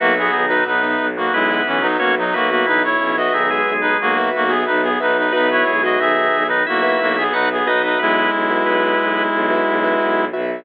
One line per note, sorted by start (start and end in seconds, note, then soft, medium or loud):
0.00 0.28 B1 medium
0.00 0.31 F#3 medium
0.00 0.13 A#3 medium
0.00 0.13 F#4 medium
0.00 0.31 F#4 medium
0.00 0.41 F#4 loud
0.00 0.41 B4 loud
0.00 0.41 E5 loud
0.18 0.46 B3 medium
0.18 0.46 G#4 medium
0.33 0.62 B1 medium
0.33 0.64 D#3 medium
0.33 0.64 D#4 medium
0.48 0.64 D#4 medium
0.48 1.04 F#4 medium
0.48 0.64 B4 medium
0.48 1.04 B4 loud
0.48 1.04 E5 loud
0.66 0.95 B1 medium
0.66 0.82 B2 medium
0.66 0.82 B3 medium
0.66 1.07 D#4 medium
0.66 1.07 B4 medium
0.83 1.10 B2 medium
0.83 1.10 B3 medium
0.99 1.28 B1 medium
1.17 1.33 B2 medium
1.17 1.33 A#3 medium
1.17 1.33 B3 medium
1.17 1.33 F#4 medium
1.32 1.61 B1 medium
1.32 1.62 G#3 medium
1.32 1.87 B3 medium
1.32 1.62 E4 medium
1.32 1.87 B4 medium
1.51 1.77 F#4 loud
1.51 1.77 B4 loud
1.51 1.77 E5 loud
1.66 1.95 B1 medium
1.66 1.82 E3 medium
1.66 1.82 C#4 medium
1.81 1.97 F#3 medium
1.81 1.97 D#4 medium
1.81 2.24 F#4 medium
1.81 2.24 B4 medium
1.81 2.24 E5 medium
1.99 2.29 B1 medium
1.99 2.15 A#3 medium
1.99 2.15 C#4 medium
1.99 2.15 F#4 medium
1.99 2.15 C#5 medium
2.18 2.34 F#3 medium
2.18 2.34 D#4 medium
2.33 2.63 B1 medium
2.33 2.50 A#3 medium
2.33 2.49 B3 medium
2.33 2.87 F#4 medium
2.33 2.50 F#4 medium
2.33 2.87 B4 medium
2.33 2.49 B4 medium
2.33 2.87 E5 medium
2.50 2.66 A#3 medium
2.50 2.66 B3 medium
2.50 2.66 F#4 medium
2.50 2.66 B4 medium
2.66 2.95 B1 medium
2.66 2.82 E3 medium
2.66 2.83 D#4 medium
2.66 2.82 E4 medium
2.66 2.83 B4 medium
2.84 3.16 E4 medium
2.84 3.16 C#5 medium
3.00 3.28 B1 medium
3.00 3.15 C#3 medium
3.00 3.15 C#4 medium
3.17 3.33 F#4 medium
3.17 3.71 F#4 loud
3.17 3.71 B4 loud
3.17 3.33 D#5 medium
3.17 3.71 E5 loud
3.32 3.60 B1 medium
3.32 3.50 D#3 medium
3.32 3.50 D#4 medium
3.32 3.73 G#4 medium
3.32 3.73 E5 medium
3.50 4.17 G#3 medium
3.50 4.17 G#4 medium
3.66 3.94 B1 medium
3.81 3.97 D#4 medium
3.81 3.97 B4 medium
4.00 4.28 B1 medium
4.00 4.30 A#3 medium
4.00 4.30 F#4 medium
4.17 4.44 F#4 loud
4.17 4.44 B4 loud
4.17 4.44 E5 loud
4.35 4.63 B1 medium
4.35 4.51 A#3 medium
4.35 4.51 F#4 medium
4.48 4.64 B3 medium
4.48 4.89 F#4 loud
4.48 4.64 G#4 medium
4.48 4.89 B4 loud
4.48 4.89 E5 medium
4.66 4.96 B1 medium
4.66 4.82 D#4 medium
4.66 4.82 B4 medium
4.83 4.98 B3 medium
4.83 4.98 G#4 medium
5.00 5.30 B1 medium
5.00 5.17 D#4 medium
5.00 5.27 F#4 loud
5.00 5.27 B4 medium
5.00 5.17 B4 medium
5.00 5.27 E5 medium
5.18 5.32 D#4 medium
5.18 5.32 B4 medium
5.32 5.63 B1 medium
5.32 5.65 B3 medium
5.32 5.49 D#4 medium
5.32 5.72 F#4 loud
5.32 5.72 B4 loud
5.32 5.65 B4 medium
5.32 5.49 B4 medium
5.32 5.72 E5 loud
5.51 5.82 E4 medium
5.51 5.82 C#5 medium
5.67 5.97 B1 medium
5.67 5.99 G#3 medium
5.67 5.99 G#4 medium
5.83 6.36 F#4 loud
5.83 5.99 F#4 medium
5.83 6.36 B4 loud
5.83 5.99 D#5 medium
5.83 6.36 E5 medium
5.99 6.27 B1 medium
5.99 6.16 D#3 medium
5.99 6.16 D#4 medium
5.99 6.47 G#4 medium
5.99 6.47 E5 medium
6.17 6.44 D#3 medium
6.17 6.44 D#4 medium
6.34 6.63 B1 medium
6.48 6.66 D#3 medium
6.48 6.63 D#4 medium
6.48 6.66 D#4 medium
6.48 6.63 B4 medium
6.67 6.96 B1 medium
6.67 6.99 A#3 medium
6.67 7.24 E4 medium
6.67 6.99 F#4 medium
6.67 7.24 E5 medium
6.83 7.09 F#4 loud
6.83 7.09 B4 loud
6.83 7.09 E5 loud
7.00 7.28 B1 medium
7.00 7.17 A#3 medium
7.00 7.17 F#4 medium
7.17 7.33 B3 medium
7.17 7.57 F#4 loud
7.17 7.33 G#4 medium
7.17 7.57 B4 loud
7.17 7.57 E5 loud
7.33 7.62 B1 medium
7.33 7.48 D#4 medium
7.33 7.49 F#4 medium
7.33 7.48 B4 medium
7.33 7.49 F#5 medium
7.52 7.68 B3 medium
7.52 7.68 G#4 medium
7.66 7.95 B1 medium
7.66 7.82 D#4 medium
7.66 8.20 F#4 medium
7.66 7.82 B4 medium
7.66 8.20 B4 medium
7.66 7.82 D#5 medium
7.66 8.20 E5 loud
7.83 7.99 D#4 medium
7.83 7.99 B4 medium
7.83 7.99 D#5 medium
7.99 8.28 B1 medium
7.99 10.25 G#3 medium
7.99 8.31 B3 medium
7.99 10.25 E4 medium
7.99 8.31 B4 loud
8.32 8.61 B1 medium
8.51 9.04 F#4 loud
8.51 9.04 B4 loud
8.51 9.04 E5 medium
8.65 8.94 B1 medium
8.65 9.23 B3 medium
8.65 9.23 B4 medium
8.99 9.28 B1 medium
9.32 9.60 B1 medium
9.50 9.77 F#4 loud
9.50 9.77 B4 medium
9.50 9.77 E5 medium
9.67 9.95 B1 medium
9.84 10.24 F#4 loud
9.84 10.24 B4 loud
9.84 10.24 E5 medium
10.00 10.28 B1 medium
10.33 10.61 B1 medium
10.33 10.60 F#4 loud
10.33 10.60 B4 medium
10.33 10.60 E5 loud